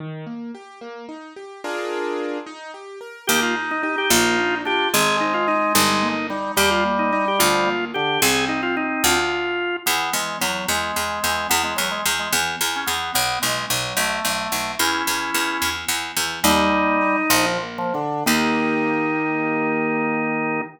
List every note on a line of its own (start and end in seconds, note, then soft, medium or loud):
0.00 0.25 D#3 medium
0.26 0.51 A#3 medium
0.55 0.79 G4 medium
0.81 1.06 A#3 medium
1.09 1.33 D#4 medium
1.36 1.61 G4 medium
1.64 2.38 D4 loud
1.64 2.38 F4 medium
1.64 2.38 G#4 medium
1.64 2.38 A#4 medium
2.46 2.71 D#4 medium
2.74 2.99 G4 medium
3.01 3.25 A#4 medium
3.27 4.04 D#2 loud
3.27 3.54 A#3 loud
3.27 4.58 D#4 loud
3.27 3.40 G4 loud
3.42 3.55 F4 medium
3.56 3.81 D#4 medium
3.71 3.82 D#4 medium
3.83 3.96 D#4 medium
3.83 4.08 G4 medium
3.98 4.11 G4 medium
4.10 4.86 A#1 loud
4.10 4.36 A#3 loud
4.10 4.55 F4 loud
4.38 4.63 D4 medium
4.65 4.88 D4 medium
4.65 4.91 F4 medium
4.65 4.89 G4 medium
4.93 5.69 G#1 loud
4.93 5.18 G#3 medium
4.93 6.08 G#3 loud
4.93 5.17 G#4 medium
5.21 5.46 C4 medium
5.21 5.34 D#4 medium
5.34 5.47 F4 medium
5.48 5.72 D#4 medium
5.48 5.73 D#4 medium
5.75 6.51 G1 loud
5.75 6.00 G3 loud
5.75 6.27 D#4 medium
6.03 6.27 A#3 medium
6.30 6.52 G3 medium
6.30 6.55 D#4 medium
6.57 7.33 D#2 loud
6.57 7.70 G3 loud
6.57 6.81 G3 medium
6.57 6.70 G4 loud
6.71 6.84 F4 medium
6.85 7.10 A#3 medium
6.99 7.12 D#4 medium
7.12 7.37 D#4 medium
7.12 7.25 D#4 medium
7.28 7.41 G4 medium
7.39 8.16 D2 loud
7.39 7.64 F3 loud
7.39 7.85 F4 medium
7.66 7.91 A#3 medium
7.94 8.18 D3 medium
7.94 8.19 D4 medium
7.94 8.21 G4 medium
8.22 8.98 C2 loud
8.22 9.17 C4 loud
8.22 8.45 G#4 medium
8.48 8.61 D#4 medium
8.63 8.76 F4 medium
8.77 9.03 D#4 medium
9.04 9.79 D2 loud
9.04 9.76 F4 medium
9.86 10.10 E2 loud
9.86 10.13 B3 medium
10.13 10.37 E2 medium
10.13 10.38 G#3 medium
10.41 10.65 E2 medium
10.41 10.66 F#3 medium
10.68 10.92 E2 medium
10.68 11.47 G#3 medium
10.96 11.20 E2 medium
11.24 11.47 E2 medium
11.49 11.74 E2 loud
11.49 11.62 B3 medium
11.64 11.77 G#3 medium
11.76 12.01 E2 medium
11.76 11.89 F#3 medium
11.91 12.04 G#3 medium
12.05 12.29 E2 medium
12.19 12.32 G#3 medium
12.33 12.56 E2 loud
12.61 12.84 E2 medium
12.76 12.89 C#4 medium
12.87 13.11 E2 medium
12.87 13.13 B3 medium
13.14 13.38 B1 loud
13.14 13.39 B3 medium
13.42 13.66 B1 medium
13.42 13.65 G#3 medium
13.70 13.93 B1 medium
13.70 13.97 F#3 medium
13.97 14.20 B1 medium
13.97 14.72 A3 medium
14.25 14.48 B1 medium
14.52 14.75 B1 medium
14.79 15.03 E2 loud
14.79 15.70 C#4 medium
14.79 15.70 E4 medium
15.07 15.31 E2 medium
15.34 15.58 E2 medium
15.62 15.85 E2 medium
15.88 16.12 E2 medium
16.17 16.40 E2 medium
16.43 17.23 D#2 loud
16.43 16.68 G3 medium
16.43 17.17 G3 loud
16.43 17.46 D#4 loud
16.71 16.97 A#3 medium
17.01 17.28 D#4 medium
17.30 18.19 A#1 loud
17.30 17.58 F3 medium
17.30 17.58 F3 loud
17.62 17.91 A#3 medium
17.78 17.94 F3 loud
17.94 18.24 D3 medium
17.94 18.24 D4 medium
18.26 20.62 D#2 loud
18.26 20.60 D#3 loud
18.26 20.61 A#3 loud
18.26 20.61 D#4 medium
18.26 20.61 D#4 loud
18.26 20.61 G4 medium